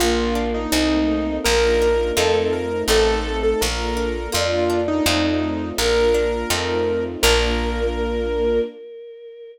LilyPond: <<
  \new Staff \with { instrumentName = "Acoustic Grand Piano" } { \time 2/4 \key bes \major \tempo 4 = 83 f'8. ees'16 ees'4 | bes'4 a'16 a'16 bes'8 | a'8. a'16 bes'4 | f'8. ees'16 ees'4 |
bes'2 | bes'2 | }
  \new Staff \with { instrumentName = "Choir Aahs" } { \time 2/4 \key bes \major bes4 ees'4 | bes'8 bes'4 r8 | a'4 bes'8 r8 | d''8 d''4 r8 |
bes'8 r4. | bes'2 | }
  \new Staff \with { instrumentName = "Orchestral Harp" } { \time 2/4 \key bes \major bes8 d'8 <a c' ees'>4 | bes8 d'8 <a c' ees' f'>4 | <a c' ees'>4 bes8 d'8 | bes8 d'8 <a c' ees' f'>4 |
bes8 d'8 <a c' ees' f'>4 | <bes d' f'>2 | }
  \new Staff \with { instrumentName = "Electric Bass (finger)" } { \clef bass \time 2/4 \key bes \major bes,,4 c,4 | bes,,4 f,4 | a,,4 bes,,4 | f,4 f,4 |
bes,,4 f,4 | bes,,2 | }
  \new Staff \with { instrumentName = "String Ensemble 1" } { \time 2/4 \key bes \major <bes d' f'>4 <a c' ees'>4 | <bes d' f'>4 <a c' ees' f'>4 | <a c' ees'>4 <bes d' f'>4 | <bes d' f'>4 <a c' ees' f'>4 |
<bes d' f'>4 <a c' ees' f'>4 | <bes d' f'>2 | }
>>